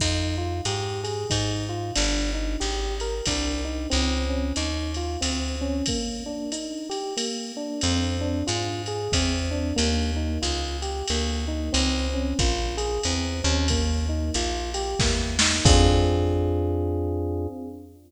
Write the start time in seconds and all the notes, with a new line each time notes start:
0.00 F2 D#4, kick, crash, ride
0.38 F4
0.65 G#2 G4, hi-hat pedal, ride
1.04 G#4, ride
1.30 G#2 D#4, kick, ride
1.69 F4
1.96 G1 D4, ride
2.34 D#4
2.60 G#1 G4, hi-hat pedal, ride
3.00 A#4, ride
3.26 C2 D4, kick, ride
3.65 D#4
3.90 C#2 C4, ride
4.29 C#4
4.56 D#2 D#4, hi-hat pedal, ride
4.94 F4, ride
5.21 D2 C4, ride
5.61 C#4
5.86 A#3, kick, ride
6.26 D4
6.52 D#4, hi-hat pedal, ride
6.90 G4, ride
7.17 A#3, ride
7.57 D4
7.81 F2 C4, ride
8.21 D4
8.47 G#2 F4, hi-hat pedal, ride
8.86 G#4, ride
9.12 E2 C4, kick, ride
9.51 D4
9.76 D#2 A#3, ride
10.16 D#4
10.42 C#2 F4, hi-hat pedal, ride
10.82 G4, ride
11.08 D2 A#3, ride
11.48 D#4
11.73 C#2 C4, ride
12.14 C#4
12.39 A#1 F4, kick, hi-hat pedal, ride
12.77 G#4, ride
13.03 E2 C4, ride
13.44 D#2 C#4
13.68 A#3, kick, ride
14.09 D#4
14.34 A#1 F4, hi-hat pedal, ride
14.74 G4, ride
14.99 E2 A#3, kick, snare
15.39 D#4, snare
15.65 F2 C4 D4 F4 G#4, kick, crash